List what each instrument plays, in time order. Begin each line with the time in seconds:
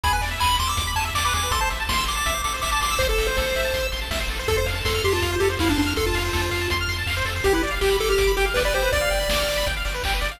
0.04 synth bass 1 E2, lead 1 (square) G#4 B5, kick, closed hi-hat
0.13 lead 1 (square) B4 G#5
0.21 synth bass 1 E2, lead 1 (square) D5, open hi-hat
0.31 lead 1 (square) E5
0.39 synth bass 1 E2, lead 1 (square) G#5 B5, kick, clap
0.50 lead 1 (square) B5
0.59 synth bass 1 E2, lead 1 (square) C6 D6, open hi-hat
0.67 lead 1 (square) D6 E6
0.77 synth bass 1 E2, lead 1 (square) D6, kick, closed hi-hat
0.87 lead 1 (square) B5
0.95 synth bass 1 E2, lead 1 (square) G#5 A5, open hi-hat
1.05 lead 1 (square) E5
1.14 synth bass 1 E2, lead 1 (square) D5 D6, kick, clap
1.25 lead 1 (square) B4 D6
1.33 synth bass 1 E2, lead 1 (square) G#4 D6, open hi-hat
1.43 lead 1 (square) B4
1.51 synth bass 1 A1, lead 1 (square) A4 C6, kick, closed hi-hat
1.61 lead 1 (square) C5 A5
1.70 synth bass 1 A1, lead 1 (square) E5, open hi-hat
1.80 lead 1 (square) A5
1.89 synth bass 1 A1, lead 1 (square) C6, kick, snare
1.97 lead 1 (square) E6
2.06 synth bass 1 A1, lead 1 (square) C6 D6, open hi-hat
2.16 lead 1 (square) A5 D6
2.26 synth bass 1 A1, lead 1 (square) E5, kick, closed hi-hat
2.34 lead 1 (square) C5
2.44 synth bass 1 A1, lead 1 (square) A4 D6, open hi-hat
2.54 lead 1 (square) C5
2.61 synth bass 1 A1, lead 1 (square) E5 D6, kick, clap
2.72 lead 1 (square) A5 D6
2.81 synth bass 1 A1, lead 1 (square) C6 D6, open hi-hat
2.91 lead 1 (square) E6
2.99 synth bass 1 A1, lead 1 (square) C5 C6, kick, closed hi-hat
3.09 lead 1 (square) A4 A5
3.18 synth bass 1 A1, lead 1 (square) E5, open hi-hat
3.27 lead 1 (square) C5
3.37 synth bass 1 A1, lead 1 (square) A4, kick, snare
3.46 lead 1 (square) C5
3.55 synth bass 1 A1, lead 1 (square) E5, open hi-hat
3.65 lead 1 (square) A5
3.74 synth bass 1 A1, lead 1 (square) C6, kick, closed hi-hat
3.83 lead 1 (square) E6
3.92 synth bass 1 A1, lead 1 (square) C6, open hi-hat
4.02 lead 1 (square) A5
4.10 synth bass 1 A1, lead 1 (square) E5, kick, snare
4.20 lead 1 (square) C5
4.28 synth bass 1 A1, lead 1 (square) A4, open hi-hat
4.39 lead 1 (square) C5
4.48 synth bass 1 F2, lead 1 (square) A4, kick, closed hi-hat
4.57 lead 1 (square) C5
4.66 synth bass 1 F2, lead 1 (square) F5, open hi-hat
4.75 lead 1 (square) A5
4.85 synth bass 1 F2, lead 1 (square) A4 C6, kick, snare
4.95 lead 1 (square) F6
5.03 synth bass 1 F2, lead 1 (square) G4 C6, open hi-hat
5.12 lead 1 (square) F4 A5
5.22 synth bass 1 F2, lead 1 (square) F5, kick, closed hi-hat
5.32 lead 1 (square) C5
5.40 synth bass 1 F2, lead 1 (square) G4 A4, open hi-hat
5.50 lead 1 (square) C5
5.59 synth bass 1 F2, lead 1 (square) E4 F5, kick, snare
5.69 lead 1 (square) D4 A5
5.76 synth bass 1 F2, lead 1 (square) D4 C6, open hi-hat
5.86 lead 1 (square) F6
5.96 synth bass 1 F2, lead 1 (square) A4 C6, kick, closed hi-hat
6.06 lead 1 (square) F4 A5
6.14 synth bass 1 F2, lead 1 (square) F5, open hi-hat
6.25 lead 1 (square) C5
6.33 synth bass 1 F2, lead 1 (square) A4, kick, snare
6.41 lead 1 (square) C5
6.51 synth bass 1 F2, lead 1 (square) F5, open hi-hat
6.61 lead 1 (square) A5
6.70 synth bass 1 F2, lead 1 (square) C6, kick, closed hi-hat
6.81 lead 1 (square) F6
6.88 synth bass 1 F2, lead 1 (square) C6, open hi-hat
6.98 lead 1 (square) A5
7.06 synth bass 1 F2, lead 1 (square) F5, kick, clap
7.17 lead 1 (square) C5
7.25 synth bass 1 F2, lead 1 (square) A4, open hi-hat
7.36 lead 1 (square) C5
7.44 synth bass 1 G1, lead 1 (square) G4, kick, closed hi-hat
7.53 lead 1 (square) E4 B4
7.63 synth bass 1 G1, lead 1 (square) D5, open hi-hat
7.71 lead 1 (square) F5
7.81 synth bass 1 G1, lead 1 (square) G4 G5, kick, clap
7.90 lead 1 (square) B5
7.99 synth bass 1 G1, lead 1 (square) A4 D6, open hi-hat
8.09 lead 1 (square) G4 F6
8.18 synth bass 1 G1, lead 1 (square) D6, kick, closed hi-hat
8.27 lead 1 (square) B5
8.37 synth bass 1 G1, lead 1 (square) G4 G5, open hi-hat
8.46 lead 1 (square) F5
8.54 synth bass 1 G1, lead 1 (square) B4 D5, kick, snare
8.65 lead 1 (square) B4 D5
8.73 synth bass 1 G1, lead 1 (square) G4 C5, open hi-hat
8.82 lead 1 (square) B4
8.92 synth bass 1 G1, lead 1 (square) D5, kick, closed hi-hat
9.01 lead 1 (square) F5
9.10 synth bass 1 G1, lead 1 (square) G5, open hi-hat
9.20 lead 1 (square) B5
9.28 synth bass 1 G1, lead 1 (square) D6, kick, snare
9.40 lead 1 (square) F6
9.48 synth bass 1 G1, lead 1 (square) D6, open hi-hat
9.57 lead 1 (square) B5
9.66 synth bass 1 G1, lead 1 (square) G5, kick, closed hi-hat
9.76 lead 1 (square) F5
9.85 synth bass 1 G1, lead 1 (square) D5, open hi-hat
9.94 lead 1 (square) B4
10.03 synth bass 1 G1, lead 1 (square) G4, kick, clap
10.14 lead 1 (square) B4
10.21 synth bass 1 G1, lead 1 (square) D5, open hi-hat
10.31 lead 1 (square) F5